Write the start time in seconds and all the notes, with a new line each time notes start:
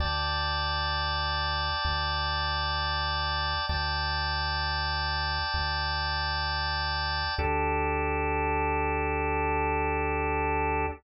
0.00 D2 D5 G5 A5
1.85 D2
3.69 D2 D5 G5 A5
5.54 D2
7.38 D2 D4 G4 A4